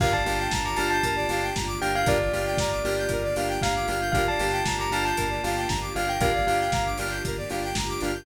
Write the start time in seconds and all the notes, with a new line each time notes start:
0.00 G1 A#3 D4 F4 G4 A#4 F5, kick, crash
0.12 D5 A5
0.25 G1 A#3 D4 F4 G4 F5, open hi-hat
0.39 G5
0.51 G1 A#5, kick, snare
0.64 A#5 D6
0.76 G1 A#3 D4 F4 G4 A5 F6, open hi-hat
0.90 A5 G6
1.03 G1 A#4, kick, closed hi-hat
1.16 D5
1.29 G1 A#3 D4 F4 G4 F5, open hi-hat
1.42 G5
1.55 G1 A#5, kick, snare
1.67 D6
1.80 G1 A#3 D4 F4 G4 G5 F6, open hi-hat
1.94 F5 G6
2.06 G1 A#3 D4 F4 G4 A#4 D5, kick, closed hi-hat
2.20 D5
2.32 G1 A#3 D4 F4 G4 F5, open hi-hat
2.46 G5
2.57 G1 A#5, kick, snare
2.71 D6
2.84 G1 A#3 D4 F4 G4 F6, open hi-hat
2.98 G6
3.09 G1 A#4, kick, closed hi-hat
3.23 D5
3.36 G1 A#3 D4 F4 G4 F5, open hi-hat
3.48 G5
3.62 G1 F5 A#5, kick, snare
3.75 D6
3.88 G1 A#3 D4 F4 G4 F6, open hi-hat
4.01 G6
4.12 G1 A#3 D4 F4 G4 A#4 F5, kick, closed hi-hat
4.28 D5 A5
4.39 G1 A#3 D4 F4 G4 F5, open hi-hat
4.52 G5
4.66 G1 A#5, kick, snare
4.78 A#5 D6
4.91 G1 A#3 D4 F4 G4 A5 F6, open hi-hat
5.05 A5 G6
5.17 G1 A#4, kick, closed hi-hat
5.30 D5
5.43 G1 A#3 D4 F4 G4 F5, open hi-hat
5.56 G5
5.68 G1 A#5, kick, snare
5.81 D6
5.95 G1 A#3 D4 F4 G4 F5 F6, open hi-hat
6.07 G5 G6
6.20 G1 A#3 D4 F4 G4 A#4 F5, kick, closed hi-hat
6.33 D5
6.46 G1 A#3 D4 F4 G4 F5, open hi-hat
6.59 G5
6.72 G1 A#5, kick, snare
6.85 D6
6.98 G1 A#3 D4 F4 G4 F6, open hi-hat
7.11 G6
7.24 G1 A#4, kick, closed hi-hat
7.37 D5
7.50 G1 A#3 D4 F4 G4 F5, open hi-hat
7.63 G5
7.75 G1 A#5, kick, snare
7.88 D6
8.01 G1 A#3 D4 F4 G4 F6, open hi-hat
8.14 G6